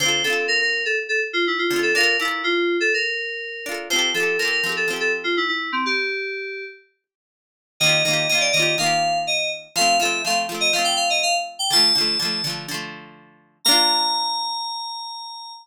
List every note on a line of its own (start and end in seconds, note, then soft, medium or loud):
0.00 0.23 D3 medium
0.00 0.23 C4 medium
0.00 0.23 C5 medium
0.06 0.23 F4 medium
0.06 0.23 A4 medium
0.24 1.59 D3 medium
0.24 1.59 C4 medium
0.24 0.45 A4 medium
0.30 1.59 F4 medium
0.30 1.59 A4 medium
0.48 0.59 A#4 medium
0.61 0.83 A#4 medium
0.85 0.97 A4 medium
1.09 1.20 A4 medium
1.33 1.45 F4 medium
1.47 1.59 E4 medium
1.59 1.78 F4 medium
1.70 1.93 D3 medium
1.70 1.93 C4 medium
1.76 1.93 F4 medium
1.76 1.93 A4 medium
1.83 1.94 A4 medium
1.95 2.17 D4 medium
1.95 2.17 F4 medium
1.95 2.16 A#4 medium
2.01 2.17 A4 medium
2.01 2.17 A#4 medium
2.20 3.54 D4 medium
2.20 2.42 E4 medium
2.20 3.54 F4 medium
2.25 3.54 A4 medium
2.25 3.54 A#4 medium
2.44 2.77 F4 medium
2.80 2.92 A4 medium
2.94 3.74 A#4 medium
3.66 3.88 D4 medium
3.66 3.88 F4 medium
3.72 3.88 A4 medium
3.72 3.88 A#4 medium
3.90 4.13 F3 medium
3.90 4.13 C4 medium
3.90 4.10 C5 medium
3.96 4.13 G4 medium
3.96 4.13 A4 medium
4.14 4.37 F3 medium
4.14 4.37 C4 medium
4.14 4.38 A4 medium
4.20 4.37 G4 medium
4.20 4.37 A4 medium
4.39 4.62 F3 medium
4.39 4.62 C4 medium
4.39 4.51 A#4 medium
4.45 4.62 G4 medium
4.45 4.62 A4 medium
4.51 4.72 A#4 medium
4.64 4.86 F3 medium
4.64 4.86 C4 medium
4.69 4.86 G4 medium
4.69 4.86 A4 medium
4.77 4.88 A4 medium
4.88 5.77 F3 medium
4.88 5.77 C4 medium
4.93 5.77 G4 medium
4.93 5.77 A4 medium
5.00 5.12 A4 medium
5.24 5.35 F4 medium
5.37 5.48 E4 medium
5.48 5.71 E4 medium
5.72 5.84 C4 medium
5.86 6.64 G4 medium
7.80 8.03 D#3 medium
7.80 8.03 A#3 medium
7.80 8.03 D#5 medium
7.86 8.03 F4 medium
7.86 8.03 G4 medium
8.05 8.27 D#3 medium
8.05 8.27 A#3 medium
8.05 8.27 D#5 medium
8.11 8.27 F4 medium
8.11 8.27 G4 medium
8.29 8.52 D#3 medium
8.29 8.52 A#3 medium
8.29 8.40 D#5 medium
8.35 8.52 F4 medium
8.35 8.52 G4 medium
8.40 8.52 D5 medium
8.52 8.76 D#3 medium
8.52 8.75 D#5 medium
8.57 8.76 A#3 medium
8.57 8.76 F4 medium
8.62 8.76 G4 medium
8.78 9.68 D#3 medium
8.78 9.68 A#3 medium
8.78 9.18 F5 medium
8.83 9.68 F4 medium
8.83 9.68 G4 medium
9.27 9.50 D#5 medium
9.76 9.98 F3 medium
9.76 9.98 A3 medium
9.76 9.96 F5 medium
9.81 9.98 C4 medium
10.00 10.22 F3 medium
10.00 10.22 A3 medium
10.00 10.21 E5 medium
10.05 10.22 C4 medium
10.24 10.47 F3 medium
10.24 10.47 A3 medium
10.24 10.37 F5 medium
10.30 10.47 C4 medium
10.49 10.71 F3 medium
10.49 10.71 A3 medium
10.54 10.71 C4 medium
10.60 10.72 D#5 medium
10.73 11.63 F3 medium
10.73 11.63 A3 medium
10.73 10.85 F5 medium
10.79 11.63 C4 medium
10.84 10.96 G5 medium
10.96 11.08 F5 medium
11.10 11.22 D#5 medium
11.23 11.34 F5 medium
11.59 11.71 G5 medium
11.70 11.93 D3 medium
11.70 11.93 F3 medium
11.70 12.52 A5 medium
11.76 11.93 A3 medium
11.95 12.18 D3 medium
11.95 12.18 F3 medium
12.01 12.18 A3 medium
12.19 12.42 D3 medium
12.19 12.42 F3 medium
12.25 12.42 A3 medium
12.44 12.66 D3 medium
12.44 12.66 F3 medium
12.50 12.66 A3 medium
12.68 13.58 D3 medium
12.68 13.58 F3 medium
12.74 13.58 A3 medium
13.65 15.54 A#3 loud
13.65 15.54 D4 loud
13.65 15.53 A#5 loud
13.71 15.54 F4 loud